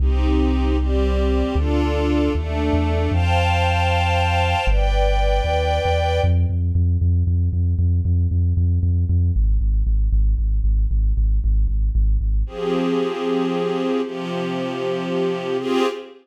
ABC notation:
X:1
M:6/8
L:1/16
Q:3/8=77
K:Cdor
V:1 name="String Ensemble 1"
[CEG]6 [G,CG]6 | [DFA]6 [A,DA]6 | [cfga]12 | [=Bdg]12 |
[K:Fdor] z12 | z12 | z12 | z12 |
[F,CGA]12 | [C,F,G]12 | [CFGA]6 z6 |]
V:2 name="Synth Bass 2" clef=bass
C,,12 | D,,6 E,,3 =E,,3 | F,,12 | G,,,6 E,,3 =E,,3 |
[K:Fdor] F,,2 F,,2 F,,2 F,,2 F,,2 F,,2 | F,,2 F,,2 F,,2 F,,2 F,,2 F,,2 | A,,,2 A,,,2 A,,,2 A,,,2 A,,,2 A,,,2 | A,,,2 A,,,2 A,,,2 A,,,2 A,,,2 A,,,2 |
z12 | z12 | z12 |]